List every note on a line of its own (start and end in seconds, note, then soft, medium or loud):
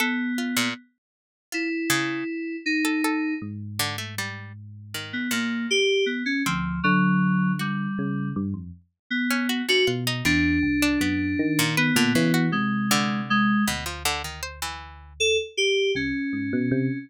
0.00 0.68 B3 medium
0.00 0.34 A4 medium
0.38 0.55 F4 medium
0.56 0.74 A#2 medium
1.52 2.56 E4 medium
1.52 1.69 F4 medium
1.90 2.24 C#3 loud
2.66 3.34 D#4 medium
2.85 3.02 A4 medium
3.04 3.38 A4 medium
3.42 5.13 G#2 medium
3.79 3.97 D3 loud
3.98 4.15 A3 medium
4.18 4.53 G3 medium
4.94 5.28 D#3 medium
5.13 5.30 B3 medium
5.31 6.33 A#2 medium
5.31 5.66 A#3 medium
5.71 6.05 G4 loud
6.06 6.23 B3 medium
6.26 6.43 C#4 medium
6.46 6.81 D2 medium
6.46 6.80 F3 medium
6.46 6.80 C4 medium
6.84 7.87 D3 medium
6.84 7.52 F#3 loud
7.59 8.29 G3 medium
7.59 8.28 F#4 soft
7.99 8.33 C#3 medium
8.36 8.53 G2 loud
8.54 8.71 F2 medium
9.10 9.62 B3 medium
9.31 9.48 C#4 medium
9.49 9.66 F#4 medium
9.69 9.86 D3 medium
9.69 9.86 F#4 loud
9.87 10.22 B2 medium
9.87 10.04 F4 medium
10.07 10.24 D#4 medium
10.25 10.59 E2 medium
10.25 10.59 C3 medium
10.25 11.62 D4 loud
10.63 10.97 C2 medium
10.82 10.99 D4 loud
11.01 11.35 F#2 medium
11.01 11.52 B3 medium
11.39 11.91 D#3 loud
11.59 11.76 A#2 loud
11.77 12.46 B3 medium
11.77 11.94 B4 medium
11.96 12.13 A#2 loud
11.96 12.13 D3 loud
12.15 12.32 C#3 medium
12.15 12.50 E3 loud
12.34 12.85 F#4 medium
12.52 13.54 C3 medium
12.52 13.21 G#3 medium
12.91 13.59 D3 loud
13.30 13.64 G#3 loud
13.67 15.39 D2 medium
13.67 13.84 B2 medium
13.86 14.03 F3 medium
14.05 14.22 D3 loud
14.24 14.41 D#3 medium
14.43 14.60 C5 medium
14.62 15.13 E3 medium
15.20 15.37 A4 loud
15.57 15.92 G4 loud
15.95 16.12 C2 medium
15.95 16.98 C#4 medium
16.33 16.50 G#2 medium
16.53 16.70 B2 loud
16.71 16.88 C3 loud